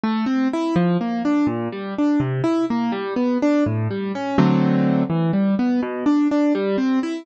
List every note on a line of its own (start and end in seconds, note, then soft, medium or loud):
0.04 0.25 A3 medium
0.26 0.48 C4 medium
0.53 0.75 E4 medium
0.76 0.97 F3 medium
1.01 1.22 A#3 medium
1.25 1.47 D4 medium
1.47 1.68 A#2 medium
1.72 1.94 G3 medium
1.98 2.20 D4 medium
2.20 2.42 C3 medium
2.44 2.65 E4 medium
2.70 2.92 A#3 medium
2.92 3.14 G3 medium
3.16 3.38 B3 medium
3.42 3.64 D4 medium
3.66 3.88 A2 medium
3.91 4.12 G3 medium
4.15 4.37 C#4 medium
4.38 5.03 D3 medium
4.38 5.03 F#3 medium
4.38 5.03 A3 medium
4.38 5.03 C4 medium
5.10 5.31 E3 medium
5.33 5.55 G3 medium
5.59 5.81 B3 medium
5.83 6.04 B2 medium
6.06 6.28 D4 medium
6.31 6.53 D4 medium
6.55 6.77 G3 medium
6.78 6.99 C4 medium
7.03 7.25 E4 medium